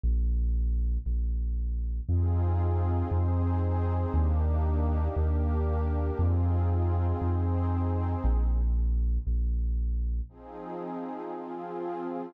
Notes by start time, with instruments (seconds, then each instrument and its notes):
0.04 synth bass 2 A#1
1.06 synth bass 2 A#1
2.09 synth bass 2 F2, pad 5 (bowed) C4 D#4 F4 G#4
3.11 synth bass 2 F2, pad 5 (bowed) C4 D#4 G#4 C5
4.14 synth bass 2 D#2, pad 5 (bowed) A#3 D4 D#4 G4
5.16 synth bass 2 D#2, pad 5 (bowed) A#3 D4 G4 A#4
6.19 synth bass 2 F2, pad 5 (bowed) C4 D#4 F4 G#4
7.21 synth bass 2 F2, pad 5 (bowed) C4 D#4 G#4 C5
8.24 synth bass 2 A#1
9.27 synth bass 2 A#1
10.29 pad 5 (bowed) F3 C4 D#4 G#4
11.32 pad 5 (bowed) F3 C4 F4 G#4